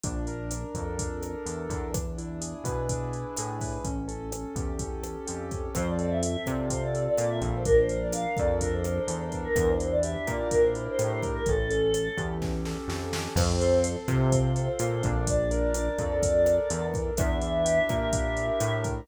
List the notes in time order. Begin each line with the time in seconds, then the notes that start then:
0.04 A#1 D4, kick, closed hi-hat
0.27 A#4, closed hi-hat
0.51 D4, cross-stick, closed hi-hat
0.74 F2 A4, kick, closed hi-hat
0.98 D4, kick, closed hi-hat
1.22 A#4, cross-stick, closed hi-hat
1.46 E2 A4, closed hi-hat
1.70 E2 D4, kick, closed hi-hat
1.94 D4, kick, cross-stick, closed hi-hat
2.18 E4, closed hi-hat
2.41 G#4, closed hi-hat
2.64 B2 B4, kick, cross-stick, closed hi-hat
2.89 D4, kick, closed hi-hat
3.13 E4, closed hi-hat
3.37 A2 G#4, cross-stick, closed hi-hat
3.61 B4, kick, open hi-hat
3.84 A1 C#4, kick, closed hi-hat
4.08 A4, closed hi-hat
4.32 C#4, cross-stick, closed hi-hat
4.56 E2 G4, kick, closed hi-hat
4.79 C#4, kick, closed hi-hat
5.03 A4, cross-stick, closed hi-hat
5.27 F2 G4, closed hi-hat
5.51 C#4, kick, closed hi-hat
5.75 F2 C4 C5, kick, cross-stick, closed hi-hat
5.88 D5
5.99 A4, closed hi-hat
6.10 E5
6.21 C4 E5, closed hi-hat
6.46 C3 F4 D5, kick, cross-stick, closed hi-hat
6.70 C4 C5, kick, closed hi-hat
6.82 D5
6.94 A4, closed hi-hat
7.07 D5
7.18 A#2 F4 D5, cross-stick, closed hi-hat
7.29 E5
7.41 A#1 C4, kick, closed hi-hat
7.55 C5
7.65 D4 A#4, kick, closed hi-hat
7.78 C5
7.89 A#4, closed hi-hat
8.00 D5
8.12 D4 F5, cross-stick, closed hi-hat
8.37 F2 A4 D5, kick, closed hi-hat
8.61 D4 A#4, kick, closed hi-hat
8.73 C5
8.84 A#4, cross-stick, closed hi-hat
8.97 C5
9.08 E2 A4 C5, closed hi-hat
9.21 C5
9.32 D4, kick, closed hi-hat
9.44 A#4
9.56 E2 A#4, kick, cross-stick, closed hi-hat
9.68 C5
9.80 E4, closed hi-hat
9.91 D5
10.03 G4 E5, closed hi-hat
10.27 A#2 A#4 D5, kick, cross-stick, closed hi-hat
10.51 D4 A#4, kick, closed hi-hat
10.62 C5
10.75 E4, closed hi-hat
10.88 C5
10.99 A2 G4 C5, cross-stick, closed hi-hat
11.11 C5
11.23 A#4, kick, closed hi-hat
11.34 A#4
11.46 A1 C#4 A4, kick, closed hi-hat
11.70 A4, closed hi-hat
11.93 C#4, cross-stick, closed hi-hat
12.17 E2 G4, kick, closed hi-hat
12.42 C#4, kick, snare
12.65 A4, snare
12.88 F2 G4, snare
13.13 C#4, snare
13.36 F2 C4 C5, kick, cross-stick, crash
13.61 A4, closed hi-hat
13.84 C4, closed hi-hat
14.08 C3 F4, kick, cross-stick, closed hi-hat
14.32 C4, kick, closed hi-hat
14.56 A4, closed hi-hat
14.79 A#2 F4, cross-stick, closed hi-hat
15.03 A#1 D4, kick, closed hi-hat
15.27 D5, kick, closed hi-hat
15.51 A#4, closed hi-hat
15.74 D4, cross-stick, closed hi-hat
15.99 F2 A4, kick, closed hi-hat
16.22 D4, kick, closed hi-hat
16.46 A#4, cross-stick, closed hi-hat
16.70 E2 A4, closed hi-hat
16.94 D4, kick, closed hi-hat
17.17 E2 D4 E5, kick, cross-stick, closed hi-hat
17.42 E4, closed hi-hat
17.65 G4, closed hi-hat
17.89 A#2 A#4, kick, cross-stick, closed hi-hat
18.13 D4, kick, closed hi-hat
18.37 E4, closed hi-hat
18.60 A2 G4, cross-stick, closed hi-hat
18.84 A#4, kick, closed hi-hat